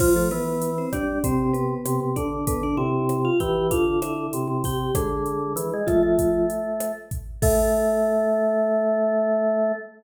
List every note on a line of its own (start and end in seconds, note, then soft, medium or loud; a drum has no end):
0.00 0.13 F3 medium
0.00 0.28 F3 medium
0.00 0.13 F4 medium
0.00 kick medium
0.00 cross-stick medium
0.00 crash loud
0.16 0.31 A3 medium
0.16 0.31 A4 medium
0.31 0.85 E3 medium
0.31 0.70 B3 medium
0.31 0.70 B4 medium
0.31 closed hi-hat medium
0.62 closed hi-hat medium
0.78 0.93 C4 medium
0.78 0.93 C5 medium
0.93 1.19 G3 medium
0.93 1.23 D4 medium
0.93 1.23 D5 medium
0.93 kick medium
0.93 cross-stick medium
0.93 closed hi-hat medium
1.24 1.74 C3 medium
1.24 1.52 C4 medium
1.24 1.52 C5 medium
1.24 kick medium
1.24 closed hi-hat loud
1.53 2.13 B3 medium
1.53 2.13 B4 medium
1.53 closed hi-hat medium
1.85 2.00 C3 medium
1.85 cross-stick medium
1.85 closed hi-hat loud
2.00 2.15 C3 medium
2.16 2.45 D3 medium
2.16 2.46 D4 medium
2.16 2.46 D5 medium
2.16 kick medium
2.16 closed hi-hat medium
2.47 2.76 D3 medium
2.47 2.62 B3 medium
2.47 2.62 B4 medium
2.47 kick medium
2.47 closed hi-hat loud
2.63 2.78 D4 medium
2.63 2.78 D5 medium
2.77 3.30 C3 medium
2.77 3.17 E4 medium
2.77 3.17 E5 medium
3.09 cross-stick medium
3.09 closed hi-hat medium
3.25 3.39 F4 medium
3.25 3.39 F5 medium
3.40 3.70 E3 medium
3.40 3.67 G4 medium
3.40 3.67 G5 medium
3.40 kick medium
3.40 closed hi-hat medium
3.71 4.27 D3 medium
3.71 4.00 F4 medium
3.71 4.00 F5 medium
3.71 kick medium
3.71 closed hi-hat loud
4.02 4.58 E4 medium
4.02 4.58 E5 medium
4.02 cross-stick medium
4.02 closed hi-hat medium
4.33 4.47 C3 medium
4.33 closed hi-hat medium
4.48 4.62 C3 medium
4.64 4.91 C3 medium
4.64 4.95 G4 medium
4.64 4.95 G5 medium
4.64 kick medium
4.64 open hi-hat medium
4.95 5.53 D3 medium
4.95 5.83 G#3 medium
4.95 5.83 G#4 medium
4.95 kick medium
4.95 cross-stick medium
4.95 closed hi-hat loud
5.26 closed hi-hat medium
5.56 5.70 E3 medium
5.56 closed hi-hat loud
5.73 5.88 G#3 medium
5.87 6.46 F3 medium
5.87 6.02 A3 medium
5.87 6.46 F4 medium
5.87 kick medium
5.87 cross-stick medium
5.87 closed hi-hat medium
6.03 6.92 A3 medium
6.19 kick medium
6.19 closed hi-hat medium
6.50 closed hi-hat medium
6.80 cross-stick medium
6.80 closed hi-hat medium
7.11 kick medium
7.11 closed hi-hat medium
7.42 9.72 A3 loud
7.42 9.71 A4 loud
7.42 kick loud
7.42 crash loud